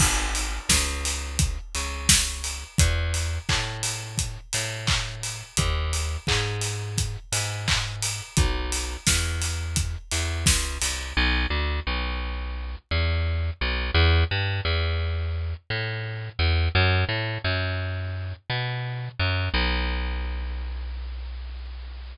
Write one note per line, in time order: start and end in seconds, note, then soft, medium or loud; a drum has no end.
0.00 0.59 G#1 medium
0.00 kick medium
0.00 crash loud
0.35 open hi-hat medium
0.69 1.58 C#2 medium
0.69 kick medium
0.69 snare loud
1.05 open hi-hat medium
1.39 kick medium
1.39 closed hi-hat loud
1.75 2.64 C#2 medium
1.75 open hi-hat medium
2.09 kick medium
2.09 snare loud
2.44 open hi-hat medium
2.78 3.39 E2 medium
2.78 kick loud
2.78 closed hi-hat loud
3.14 open hi-hat medium
3.49 4.38 A2 medium
3.49 kick medium
3.49 clap loud
3.83 open hi-hat medium
4.18 kick medium
4.18 closed hi-hat loud
4.53 5.43 A2 medium
4.53 open hi-hat medium
4.87 kick medium
4.87 clap loud
5.23 open hi-hat medium
5.57 6.17 D#2 medium
5.57 kick medium
5.57 closed hi-hat loud
5.93 open hi-hat medium
6.27 7.17 G#2 medium
6.27 kick medium
6.27 clap loud
6.61 open hi-hat medium
6.98 kick medium
6.98 closed hi-hat loud
7.32 8.21 G#2 medium
7.32 open hi-hat medium
7.68 kick medium
7.68 clap loud
8.02 open hi-hat medium
8.37 8.97 B1 medium
8.37 kick loud
8.37 closed hi-hat loud
8.72 open hi-hat medium
9.07 9.96 E2 medium
9.07 kick medium
9.07 snare loud
9.42 open hi-hat medium
9.76 kick medium
9.76 closed hi-hat loud
10.11 10.45 E2 medium
10.11 open hi-hat medium
10.46 10.78 C#2 medium
10.46 kick medium
10.46 snare loud
10.82 11.13 C2 medium
10.82 open hi-hat medium
11.17 11.47 B1 loud
11.50 11.80 D2 medium
11.87 12.76 B1 medium
12.91 13.50 E2 medium
13.61 13.91 B1 medium
13.94 14.24 E2 loud
14.31 14.61 G2 medium
14.65 15.54 E2 medium
15.70 16.30 A2 medium
16.39 16.69 E2 medium
16.75 17.05 F#2 loud
17.09 17.38 A2 medium
17.44 18.33 F#2 medium
18.50 19.09 B2 medium
19.19 19.49 F#2 medium
19.54 22.16 B1 loud